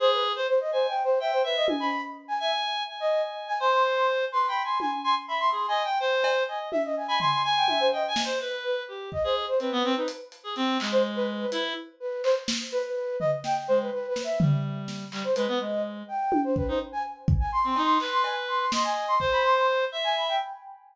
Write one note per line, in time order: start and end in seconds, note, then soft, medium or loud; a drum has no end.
0.00 0.32 G#4 loud
0.00 0.11 C5 loud
0.12 0.23 B4 medium
0.36 0.47 C5 loud
0.48 0.59 C5 loud
0.60 0.71 D#5 medium
0.72 0.86 C5 medium
0.72 0.94 G#5 medium
0.88 1.02 G5 medium
1.04 1.19 C5 medium
1.20 1.31 E5 medium
1.20 1.42 G5 medium
1.32 1.43 C5 medium
1.44 1.55 B4 medium
1.44 1.66 E5 loud
1.56 1.67 D#5 medium
1.68 1.90 G#5 medium
1.68 high tom medium
1.80 2.02 B5 loud
2.28 2.39 G#5 medium
2.40 2.51 E5 medium
2.40 2.83 G#5 loud
2.88 3.53 G#5 medium
3.00 3.22 D#5 medium
3.48 3.59 G#5 loud
3.60 4.25 C5 loud
3.60 3.71 C6 medium
3.72 3.83 C6 medium
3.96 4.07 C6 medium
4.32 4.46 B4 medium
4.32 4.46 C6 medium
4.48 4.62 G5 medium
4.48 4.62 B5 loud
4.64 4.78 G#5 medium
4.64 4.78 C6 medium
4.80 4.91 G#5 medium
4.80 5.02 G#5 soft
4.80 high tom medium
5.04 5.15 G#5 medium
5.04 5.15 C6 medium
5.28 5.50 E5 medium
5.28 5.39 B5 medium
5.40 5.51 C6 loud
5.52 5.66 G#4 medium
5.52 5.66 C6 medium
5.68 5.83 D#5 medium
5.68 5.82 G#5 loud
5.84 5.98 G5 medium
6.00 6.43 C5 loud
6.24 cowbell loud
6.48 6.69 D#5 medium
6.48 6.59 G#5 medium
6.72 6.83 E5 loud
6.72 high tom medium
6.84 6.95 D#5 medium
6.96 7.07 G#5 medium
7.08 7.19 G#5 loud
7.08 7.19 B5 loud
7.20 7.42 G#5 medium
7.20 7.31 C6 loud
7.20 floor tom medium
7.32 7.43 C6 loud
7.44 7.87 G#5 loud
7.44 7.55 G#5 medium
7.56 7.67 G5 medium
7.68 7.79 E5 medium
7.68 high tom medium
7.80 7.91 C5 medium
7.92 8.03 D#5 medium
7.92 8.07 G5 medium
8.08 8.22 G#5 loud
8.16 snare medium
8.24 8.39 C5 medium
8.40 8.83 B4 medium
8.40 8.51 B4 medium
8.64 8.75 B4 medium
8.88 9.10 G4 medium
9.12 9.23 D#5 medium
9.12 kick medium
9.24 9.46 G#4 medium
9.24 9.35 C5 medium
9.48 9.59 C5 medium
9.60 9.71 C4 medium
9.60 9.92 B4 medium
9.60 closed hi-hat medium
9.72 9.83 B3 loud
9.84 9.95 C4 loud
9.96 10.07 D#4 medium
9.96 10.07 B4 medium
10.08 closed hi-hat medium
10.32 closed hi-hat medium
10.44 10.54 G#4 medium
10.56 10.78 C4 loud
10.56 closed hi-hat medium
10.80 11.45 G#3 medium
10.80 clap medium
10.92 11.03 C5 loud
11.16 11.27 B4 loud
11.40 11.62 B4 medium
11.52 11.73 E4 loud
11.52 closed hi-hat medium
12.00 12.22 B4 medium
12.24 12.35 C5 loud
12.24 clap medium
12.48 snare medium
12.72 12.83 B4 loud
12.84 13.16 B4 medium
13.20 13.31 D#5 loud
13.20 floor tom medium
13.44 13.55 G5 medium
13.44 snare medium
13.68 13.90 G#3 medium
13.68 13.79 C5 loud
13.80 13.91 B4 medium
13.92 14.06 B4 medium
14.08 14.22 B4 medium
14.16 snare medium
14.24 14.38 E5 medium
14.40 15.05 G3 medium
14.40 floor tom loud
14.88 snare medium
15.12 15.23 G3 medium
15.12 clap medium
15.24 15.35 C5 medium
15.36 15.47 G#3 medium
15.36 15.58 B4 loud
15.36 closed hi-hat medium
15.48 15.59 B3 medium
15.60 16.03 G#3 medium
15.60 15.81 D#5 medium
16.08 16.41 G5 medium
16.32 high tom medium
16.44 16.55 C5 medium
16.56 16.67 B4 medium
16.56 kick medium
16.68 16.79 D#4 medium
16.68 16.79 C5 medium
16.92 17.03 G#5 medium
17.28 kick loud
17.40 17.51 G#5 medium
17.52 17.67 C6 medium
17.64 17.75 C4 medium
17.64 17.82 C6 medium
17.76 17.98 D#4 loud
17.76 cowbell medium
17.84 17.98 C6 medium
18.00 18.65 B4 medium
18.00 clap medium
18.12 18.23 C6 medium
18.24 18.35 G#5 medium
18.24 cowbell medium
18.48 18.59 C6 medium
18.60 18.71 C6 medium
18.72 19.15 D#5 medium
18.72 18.83 C6 medium
18.72 snare medium
18.84 19.06 G#5 medium
19.08 19.19 C6 loud
19.20 19.85 C5 loud
19.20 kick medium
19.32 19.43 B5 loud
19.44 19.55 C6 loud
19.56 19.67 C6 medium
19.92 20.35 E5 loud
20.04 20.15 G#5 loud
20.16 20.27 B5 medium
20.28 20.39 G5 medium